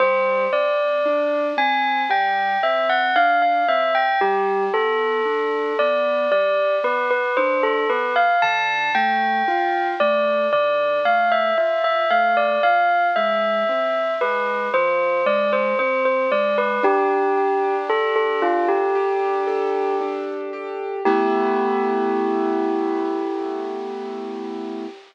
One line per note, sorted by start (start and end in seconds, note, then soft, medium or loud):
0.00 0.47 G3 loud
0.00 0.45 C5 loud
0.53 1.00 C4 medium
0.53 1.47 D5 medium
1.05 1.53 D4 medium
1.57 2.05 C4 medium
1.57 2.02 G#5 medium
2.09 2.57 G3 medium
2.09 2.58 G5 medium
2.63 3.11 C4 medium
2.63 2.88 E5 medium
2.89 3.14 F#5 medium
3.16 3.63 D4 medium
3.16 3.41 F5 loud
3.42 3.67 F5 medium
3.68 4.16 C4 medium
3.68 3.93 E5 loud
3.95 4.20 G5 medium
4.21 4.69 G3 medium
4.21 4.64 G4 loud
4.74 5.21 B3 medium
4.74 5.76 A4 medium
5.25 5.73 D4 medium
5.79 6.27 B3 medium
5.79 6.30 D5 medium
6.31 6.79 G3 medium
6.31 6.75 D5 medium
6.84 7.31 B3 medium
6.84 7.09 B4 medium
7.11 7.36 B4 medium
7.37 7.85 D4 medium
7.37 7.62 C5 medium
7.63 7.88 A4 medium
7.89 8.37 B3 medium
7.89 8.14 B4 medium
8.16 8.41 F5 medium
8.42 8.90 D3 loud
8.42 8.91 A5 loud
8.95 9.42 A3 medium
8.95 9.87 G5 medium
9.48 9.95 F4 medium
10.00 10.48 A3 medium
10.00 10.47 D5 medium
10.53 11.00 D3 medium
10.53 10.99 D5 medium
11.05 11.52 A3 medium
11.05 11.30 F5 medium
11.32 11.57 E5 medium
11.57 12.05 F4 medium
11.57 11.83 E5 medium
11.84 12.09 E5 medium
12.11 12.58 A3 medium
12.11 12.36 F5 medium
12.37 12.62 D5 medium
12.63 13.11 F3 medium
12.63 13.07 F5 medium
13.16 13.64 G#3 medium
13.16 14.13 E5 medium
13.69 14.16 C4 medium
14.21 14.69 G#3 medium
14.21 14.68 B4 medium
14.74 15.21 F3 medium
14.74 15.25 C5 loud
15.26 15.73 G#3 medium
15.26 15.51 D5 medium
15.53 15.78 C5 medium
15.79 16.27 C4 medium
15.79 16.04 C5 medium
16.05 16.30 C5 medium
16.32 16.79 G#3 medium
16.32 16.57 D5 medium
16.58 16.83 B4 medium
16.83 18.42 D4 loud
16.83 17.75 G4 loud
17.37 18.95 G4 medium
17.89 18.14 A4 medium
17.89 19.47 A4 medium
18.16 18.41 A4 medium
18.42 20.00 D4 medium
18.42 18.67 F4 medium
18.68 19.96 G4 medium
18.95 20.52 G4 medium
19.47 20.97 A4 medium
20.01 21.01 D4 medium
20.53 21.03 G4 medium
21.05 24.85 A3 loud
21.05 24.85 B3 loud
21.05 24.85 E4 loud
21.05 24.84 G4 loud